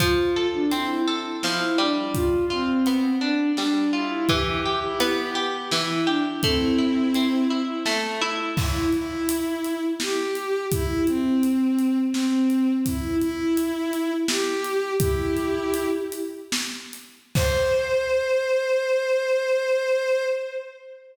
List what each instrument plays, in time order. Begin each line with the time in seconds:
0.00 orchestral harp F3, violin F4, kick, closed hi-hat
0.36 orchestral harp A4
0.53 violin D4
0.70 orchestral harp C4, violin E4, closed hi-hat
1.08 orchestral harp A4
1.43 orchestral harp F3, violin E4, snare
1.78 orchestral harp G3, violin D4
2.13 violin F4, kick, closed hi-hat
2.50 violin C4, orchestral harp F4
2.86 orchestral harp B3, closed hi-hat
3.21 violin D4, orchestral harp D4
3.57 orchestral harp G3, violin D4, snare
3.93 violin E4, orchestral harp F4
4.29 orchestral harp E3, violin G4, kick, closed hi-hat
4.65 orchestral harp G4
4.83 violin E4
5.00 orchestral harp B3, violin G4, closed hi-hat
5.35 orchestral harp G4
5.71 orchestral harp E3, violin E4, snare
6.06 violin D4, orchestral harp G4
6.43 orchestral harp A3, violin C4 E4, kick, closed hi-hat
6.78 orchestral harp E4
7.14 orchestral harp C4, closed hi-hat
7.50 orchestral harp E4
7.86 orchestral harp A3, snare
8.21 orchestral harp E4
8.57 violin E4, kick, crash
8.92 violin E4, closed hi-hat
9.29 closed hi-hat
9.64 closed hi-hat
10.00 violin G4, snare
10.35 closed hi-hat
10.71 violin E4, kick, closed hi-hat
11.07 violin C4, closed hi-hat
11.43 closed hi-hat
11.79 closed hi-hat
12.14 violin C4, snare
12.50 closed hi-hat
12.86 violin E4, kick, closed hi-hat
13.20 violin E4, closed hi-hat
13.57 closed hi-hat
13.93 closed hi-hat
14.28 violin G4, snare
14.64 closed hi-hat
14.99 violin E4 G4, kick, closed hi-hat
15.36 closed hi-hat
15.74 closed hi-hat
16.12 closed hi-hat
16.52 snare
16.93 closed hi-hat
17.35 violin C5, kick, crash